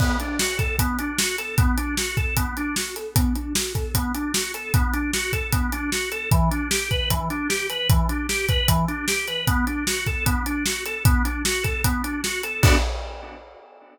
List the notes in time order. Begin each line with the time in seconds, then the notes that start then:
0.00 B3, kick, crash
0.20 D4, closed hi-hat
0.39 F#4, snare
0.58 A4, kick, closed hi-hat
0.79 B3, kick, closed hi-hat
0.99 D4, closed hi-hat
1.18 F#4, snare
1.38 A4, closed hi-hat
1.58 B3, kick, closed hi-hat
1.77 D4, closed hi-hat
1.97 F#4, snare
2.17 A4, kick, closed hi-hat
2.37 B3, kick, closed hi-hat
2.57 D4, closed hi-hat
2.76 F#4, snare
2.96 A4, closed hi-hat
3.15 B3, kick, closed hi-hat
3.35 D4, closed hi-hat
3.55 F#4, snare
3.74 A4, kick, closed hi-hat
3.94 B3, kick, closed hi-hat
4.14 D4, closed hi-hat
4.34 F#4, snare
4.54 A4, closed hi-hat
4.74 B3, kick, closed hi-hat
4.93 D4, closed hi-hat
5.13 F#4, snare
5.33 A4, kick, closed hi-hat
5.52 B3, kick, closed hi-hat
5.72 D4, closed hi-hat
5.92 F#4, snare
6.11 A4, closed hi-hat
6.31 E3, kick, closed hi-hat
6.51 D4, closed hi-hat
6.70 G4, snare
6.91 B4, kick, closed hi-hat
7.10 E3, kick, closed hi-hat
7.30 D4, closed hi-hat
7.49 G4, snare
7.70 B4, closed hi-hat
7.90 E3, kick, closed hi-hat
8.09 D4, closed hi-hat
8.29 G4, snare
8.49 B4, kick, closed hi-hat
8.68 E3, kick, closed hi-hat
8.88 D4, closed hi-hat
9.08 G4, snare
9.28 B4, closed hi-hat
9.47 B3, kick, closed hi-hat
9.67 D4, closed hi-hat
9.87 F#4, snare
10.06 A4, kick, closed hi-hat
10.26 B3, kick, closed hi-hat
10.46 D4, closed hi-hat
10.66 F#4, snare
10.86 A4, closed hi-hat
11.05 B3, kick, closed hi-hat
11.25 D4, closed hi-hat
11.45 F#4, snare
11.63 A4, kick, closed hi-hat
11.84 B3, kick, closed hi-hat
12.03 D4, closed hi-hat
12.24 F#4, snare
12.43 A4, closed hi-hat
12.62 B3 D4 F#4 A4, kick, crash